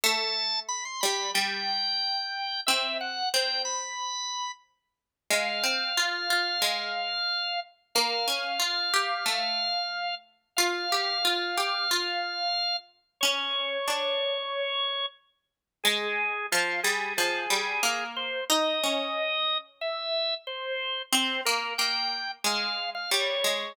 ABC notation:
X:1
M:4/4
L:1/16
Q:1/4=91
K:Em
V:1 name="Drawbar Organ"
a4 b c' b2 g8 | e2 f2 g2 b6 z4 | [K:Fm] f16 | f16 |
f16 | d14 z2 | A4 F2 A2 A6 c2 | e8 =e4 c4 |
c2 B2 g4 f3 f d4 |]
V:2 name="Pizzicato Strings"
A,6 G,2 G,8 | C4 C10 z2 | [K:Fm] A,2 C2 F2 F2 A,8 | B,2 D2 F2 G2 =A,8 |
F2 G2 F2 G2 F8 | D4 =D8 z4 | A,4 F,2 G,2 F,2 G,2 B,4 | E2 D10 z4 |
C2 B,2 B,4 A,4 G,2 A,2 |]